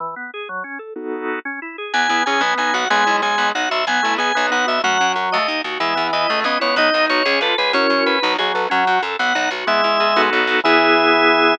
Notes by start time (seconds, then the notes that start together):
0.00 E3
0.16 B3
0.34 G#4
0.49 F#3
0.64 C#4
0.79 A4
0.96 B3 D#4 F#4 A4
1.45 C#4
1.62 E4
1.78 G#4
1.93 E2 B3 G#5
2.08 E2 B3 E4
2.26 E2 C#4 G#4 G#5
2.41 B1 B3
2.58 B1 D#4 G#5
2.73 B1 F#4 F#5
2.90 B1 G#3 B3 G#5
3.06 B1 E4
3.22 B1 G#3 G#4 G#5
3.38 B1 B3
3.55 B1 D#4 F#5
3.69 B1 F#4 E5
3.87 B1 B3 G#5
4.03 B1 A3 E4
4.18 B1 B3 G#4 G#5
4.35 B1 B3
4.51 B1 D#4 F#5
4.67 B1 F#4 E5
4.83 F#2 F#3 A3 F#5
5.00 F#2 C#4
5.16 F#2 F#4
5.32 D#2 A3 D#5
5.48 D#2 D#4
5.64 D#2 F#4
5.80 E2 E3 G#3 E5
5.95 E2 B3
6.13 E2 E4 D#5
6.29 C#2 A3
6.44 C#2 B3 C#4 D#5
6.60 C#2 B3 E4 C#5
6.76 B1 B3 D#4 D#5
6.93 B1 D#4
7.09 B1 F#4 C#5
7.25 C#2 C#4 G#4
7.41 C#2 F4 A4 B4
7.58 C#2 G#4 B4
7.73 F#2 C#4 E4 F#4 A#4 C#5
7.90 F#2
8.06 F#2 B4
8.22 B1 F#3 D#4
8.38 B1 F#3 F#4 G#4
8.54 B1 F#3 A4 B4
8.70 F#2 F#3 C#4 F#5
8.87 F#2 F#4
9.02 F#2 A4
9.19 B1 B3 F#5
9.35 B1 D#4
9.51 B1 F#4
9.67 E2 G#3 B3 E5
9.84 E2 E4
10.00 E2 G#4
10.16 B1 B3 D#4 F#4 A4
10.33 B1
10.47 B1
10.64 E2 E3 B3 E4 G#4 E5